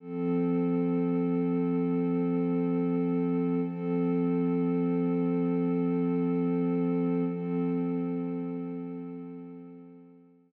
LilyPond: \new Staff { \time 4/4 \key f \lydian \tempo 4 = 66 <f c' a'>1 | <f c' a'>1 | <f c' a'>1 | }